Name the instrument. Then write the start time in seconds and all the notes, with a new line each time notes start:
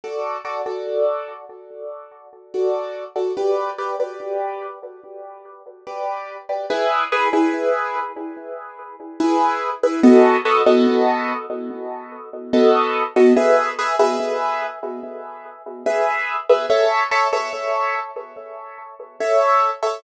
acoustic grand piano
0.04 F#4 A4 D5
0.45 F#4 A4 D5
0.66 F#4 A4 D5
2.54 F#4 A4 D5
3.16 F#4 A4 D5
3.37 G4 B4 D5
3.78 G4 B4 D5
4.00 G4 B4 D5
5.87 G4 B4 D5
6.49 G4 B4 D5
6.70 E4 G#4 B4
7.12 E4 G#4 B4
7.33 E4 G#4 B4
9.20 E4 G#4 B4
9.83 E4 G#4 B4
10.03 B3 F#4 A4 D#5
10.45 B3 F#4 A4 D#5
10.66 B3 F#4 A4 D#5
12.53 B3 F#4 A4 D#5
13.16 B3 F#4 A4 D#5
13.36 G#4 B4 E5
13.79 G#4 B4 E5
13.99 G#4 B4 E5
15.86 G#4 B4 E5
16.49 G#4 B4 E5
16.70 A4 C#5 E5
17.11 A4 C#5 E5
17.33 A4 C#5 E5
19.20 A4 C#5 E5
19.83 A4 C#5 E5